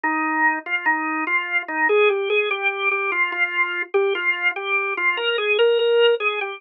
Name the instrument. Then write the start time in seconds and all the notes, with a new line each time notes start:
drawbar organ
0.04 D#4
0.66 F4
0.86 D#4
1.27 F4
1.68 D#4
1.89 G#4
2.09 G4
2.30 G#4
2.51 G4
2.91 G4
3.12 F4
3.32 F4
3.94 G4
4.15 F4
4.56 G4
4.97 F4
5.17 A#4
5.38 G#4
5.59 A#4
5.79 A#4
6.20 G#4
6.41 G4